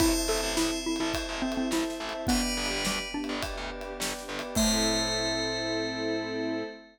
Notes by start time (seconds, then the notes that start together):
0.00 A1 C4 E4 A4 C5 E5 A5, kick, ride
0.28 A1 C4 E4 A4 C5 E5 A5
0.38 ride
0.43 A1
0.57 A1 E4, snare
0.85 C4 E4 A4
0.96 ride
1.00 A1 E4 C5 E5 A5
1.14 C5 E5 A5, kick, ride
1.29 A1
1.42 C4 E4 C5 E5 A5
1.46 A4
1.52 ride
1.57 C4
1.71 A1 E4 C5 E5 A5, snare
1.90 snare
2.00 A1 C4 E4 A4 C5 E5 A5
2.09 ride
2.14 C5 E5 A5
2.27 G1 B3 D4 G4 B4 D5 G5, kick, ride
2.31 G4
2.57 G1 B3 D4 G4 B4 D5 G5
2.66 ride
2.71 G1
2.85 D2 G3, snare
3.14 B3 D4 G4
3.24 ride
3.29 G1 B4 D5 G5
3.43 B4 D5 G5, kick, ride
3.57 D2
3.71 B3 D4 G4 B4 D5 G5
3.81 ride
4.00 G1 B4 D5 G5, snare
4.18 snare
4.28 G1 B3 D4 G4 B4 D5 G5
4.39 B4 D5 G5, ride
4.55 A2 A3 C4 E4 A4 C5 E5 A5, kick, crash
4.60 A4